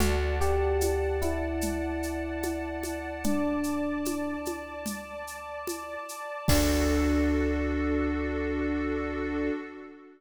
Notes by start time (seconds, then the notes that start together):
0.00 D2 F#4 D5 F#5 A5, low conga, shaker
0.41 G4, shaker
0.81 high conga, shaker
1.22 E4, high conga, shaker
1.61 low conga, shaker
2.03 shaker
2.43 high conga, shaker
2.83 high conga, shaker
3.24 D4 D5 A5 D6, low conga, shaker
3.64 shaker
4.05 high conga, shaker
4.45 high conga, shaker
4.86 low conga, shaker
5.27 shaker
5.67 high conga, shaker
6.09 shaker
6.48 D2 D4 F#4 A4, kick, crash